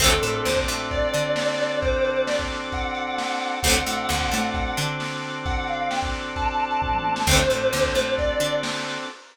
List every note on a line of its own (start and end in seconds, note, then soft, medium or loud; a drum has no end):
0.00 0.19 D2 medium
0.00 0.09 F#3 loud
0.00 0.09 A3 loud
0.00 0.09 C4 loud
0.00 3.56 C4 medium
0.00 3.56 D4 medium
0.00 3.56 F#4 medium
0.00 3.56 A4 medium
0.00 0.20 A4 medium
0.00 kick loud
0.00 crash loud
0.06 0.09 D3 loud
0.11 closed hi-hat medium
0.22 0.42 A2 medium
0.22 0.42 A3 medium
0.22 0.43 A4 medium
0.22 closed hi-hat medium
0.34 closed hi-hat medium
0.45 0.65 D2 medium
0.45 0.65 D3 medium
0.45 0.56 C5 medium
0.45 snare loud
0.56 kick medium
0.56 closed hi-hat medium
0.68 1.07 A2 medium
0.68 1.07 A3 medium
0.68 closed hi-hat medium
0.80 closed hi-hat medium
0.91 1.78 D5 medium
0.91 kick medium
0.91 closed hi-hat loud
1.02 closed hi-hat medium
1.14 3.27 D3 medium
1.14 3.26 D4 medium
1.14 closed hi-hat medium
1.25 closed hi-hat medium
1.36 snare loud
1.48 closed hi-hat medium
1.59 closed hi-hat medium
1.70 closed hi-hat medium
1.82 2.03 C5 medium
1.82 kick loud
1.82 closed hi-hat loud
1.92 closed hi-hat medium
2.04 2.24 C5 medium
2.04 closed hi-hat medium
2.16 closed hi-hat medium
2.27 2.38 D5 medium
2.27 snare loud
2.38 kick medium
2.38 closed hi-hat medium
2.50 closed hi-hat medium
2.62 closed hi-hat medium
2.72 3.57 F#5 medium
2.72 kick medium
2.72 closed hi-hat loud
2.84 closed hi-hat medium
2.95 closed hi-hat medium
3.07 closed hi-hat medium
3.18 snare loud
3.29 closed hi-hat medium
3.41 closed hi-hat medium
3.52 closed hi-hat medium
3.63 3.83 D2 medium
3.63 3.73 A3 loud
3.63 3.73 C4 loud
3.63 7.21 C4 medium
3.63 7.21 D4 medium
3.63 7.21 F#4 medium
3.63 7.21 A4 medium
3.63 4.49 F#5 medium
3.63 kick medium
3.63 closed hi-hat loud
3.68 3.73 D3 loud
3.68 3.73 F#3 loud
3.74 closed hi-hat medium
3.86 4.06 A2 medium
3.86 4.06 A3 medium
3.86 closed hi-hat medium
3.98 closed hi-hat medium
4.09 4.29 D2 medium
4.09 4.28 D3 medium
4.09 snare loud
4.21 kick medium
4.21 closed hi-hat medium
4.32 4.72 A2 medium
4.32 4.70 A3 medium
4.32 closed hi-hat medium
4.43 closed hi-hat medium
4.54 4.74 F#5 medium
4.54 kick medium
4.54 closed hi-hat medium
4.66 closed hi-hat medium
4.77 6.90 D3 medium
4.77 6.90 D4 medium
4.77 closed hi-hat medium
4.88 closed hi-hat medium
5.00 snare medium
5.11 closed hi-hat medium
5.23 closed hi-hat medium
5.34 closed hi-hat medium
5.46 5.66 F#5 medium
5.46 kick loud
5.46 closed hi-hat loud
5.57 closed hi-hat medium
5.68 5.88 F5 medium
5.68 closed hi-hat medium
5.79 closed hi-hat medium
5.91 6.02 G5 medium
5.91 snare loud
6.03 kick medium
6.03 closed hi-hat medium
6.14 closed hi-hat medium
6.26 closed hi-hat medium
6.36 7.21 A5 medium
6.36 kick medium
6.36 closed hi-hat loud
6.48 closed hi-hat medium
6.60 closed hi-hat medium
6.71 closed hi-hat medium
6.82 kick medium
6.82 floor tom medium
6.93 mid tom medium
7.04 high tom medium
7.16 snare loud
7.27 7.46 D2 medium
7.27 7.36 A3 medium
7.27 7.36 C4 loud
7.27 9.05 C4 medium
7.27 9.05 D4 medium
7.27 9.05 F#4 medium
7.27 9.05 A4 medium
7.27 8.10 C5 medium
7.27 kick loud
7.27 crash loud
7.31 7.36 D3 loud
7.31 7.36 F#3 loud
7.39 closed hi-hat medium
7.50 7.70 A2 medium
7.50 7.69 A3 medium
7.50 closed hi-hat medium
7.61 closed hi-hat medium
7.73 7.92 D2 medium
7.73 7.92 D3 medium
7.73 snare loud
7.84 kick medium
7.84 closed hi-hat medium
7.95 8.34 A2 medium
7.95 8.34 A3 medium
7.95 closed hi-hat medium
8.07 closed hi-hat medium
8.18 8.55 D5 medium
8.18 kick medium
8.18 closed hi-hat loud
8.29 closed hi-hat medium
8.40 8.98 D3 medium
8.40 8.99 D4 medium
8.40 closed hi-hat medium
8.53 closed hi-hat medium
8.63 snare loud
8.75 closed hi-hat medium
8.86 closed hi-hat medium
8.98 open hi-hat medium